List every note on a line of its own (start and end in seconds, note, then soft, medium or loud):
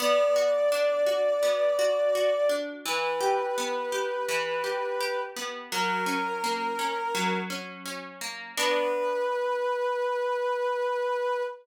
0.00 1.42 B3 loud
0.00 2.53 D5 loud
0.36 1.06 F#4 medium
0.72 2.49 D4 medium
1.07 1.78 F#4 medium
1.43 2.78 B3 medium
1.79 2.15 F#4 medium
2.15 2.83 F#4 medium
2.49 2.83 D4 medium
2.86 4.28 E3 medium
2.86 5.20 B4 medium
3.21 3.92 G4 medium
3.58 5.36 B3 medium
3.92 4.63 G4 medium
4.29 5.64 E3 medium
4.64 5.00 G4 medium
5.00 5.68 G4 medium
5.36 5.70 B3 medium
5.71 7.14 F#3 loud
5.71 7.36 A#4 loud
6.06 6.78 C#4 medium
6.44 8.21 A#3 medium
6.79 7.50 C#4 medium
7.15 8.50 F#3 medium
7.50 7.85 C#4 medium
7.86 8.53 C#4 medium
8.21 8.55 A#3 medium
8.57 11.42 B3 medium
8.57 11.42 D4 loud
8.57 11.42 F#4 loud
8.57 11.42 B4 loud